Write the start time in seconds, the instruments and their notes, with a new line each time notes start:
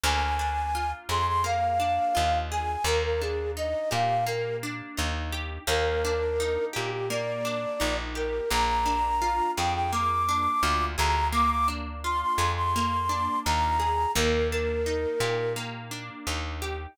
0.04 electric bass (finger) D2, acoustic guitar (steel) A#3, flute G#5
0.39 acoustic guitar (steel) D4
0.75 acoustic guitar (steel) F4
1.09 electric bass (finger) F2, acoustic guitar (steel) G#4, flute C6
1.27 flute C6
1.44 acoustic guitar (steel) A#3, flute F5
1.80 acoustic guitar (steel) D4
2.15 electric bass (finger) D#2, acoustic guitar (steel) F4
2.51 acoustic guitar (steel) G#4, flute G#5
2.84 electric bass (finger) D#2, acoustic guitar (steel) A#3, flute A#4
3.04 flute A#4
3.21 acoustic guitar (steel) D4, flute G#4
3.57 acoustic guitar (steel) D#4, flute D#5
3.91 electric bass (finger) A#2, acoustic guitar (steel) G4, flute F5
4.26 acoustic guitar (steel) A#3, flute A#4
4.63 acoustic guitar (steel) D4
4.97 electric bass (finger) D#2, acoustic guitar (steel) D#4
5.32 acoustic guitar (steel) G4
5.67 electric bass (finger) D#2, acoustic guitar (steel) A#3, flute A#4
6.05 acoustic guitar (steel) D4
6.40 acoustic guitar (steel) D#4
6.73 electric bass (finger) A#2, acoustic guitar (steel) G4, flute G4
6.92 flute G4
7.10 acoustic guitar (steel) A#3, flute D5
7.45 acoustic guitar (steel) D4
7.80 electric bass (finger) A#1, acoustic guitar (steel) D#4
8.15 acoustic guitar (steel) G4, flute A#4
8.50 electric bass (finger) A#1, acoustic guitar (steel) A#3, flute A#5
8.86 acoustic guitar (steel) D4
9.22 acoustic guitar (steel) F4
9.57 electric bass (finger) F2, acoustic guitar (steel) G#4, flute G5
9.74 flute G5
9.92 acoustic guitar (steel) A#3, flute D6
10.29 acoustic guitar (steel) D4
10.63 electric bass (finger) D2, acoustic guitar (steel) F4
10.98 electric bass (finger) D2, acoustic guitar (steel) G#4, flute A#5
11.32 acoustic guitar (steel) A#3, flute D6
11.51 flute D6
11.68 acoustic guitar (steel) D4
12.04 acoustic guitar (steel) F4, flute C6
12.21 flute C6
12.38 electric bass (finger) F2, acoustic guitar (steel) G#4
12.57 flute C6
12.76 acoustic guitar (steel) A#3
13.09 acoustic guitar (steel) D4
13.45 electric bass (finger) D#2, acoustic guitar (steel) F4, flute A#5
13.80 acoustic guitar (steel) G#4
14.15 electric bass (finger) D#2, acoustic guitar (steel) A#3, flute A#4
14.51 acoustic guitar (steel) D4, flute A#4
14.86 acoustic guitar (steel) D#4
15.20 electric bass (finger) A#2, acoustic guitar (steel) G4
15.56 acoustic guitar (steel) A#3
15.91 acoustic guitar (steel) D4
16.27 electric bass (finger) D#2, acoustic guitar (steel) D#4
16.62 acoustic guitar (steel) G4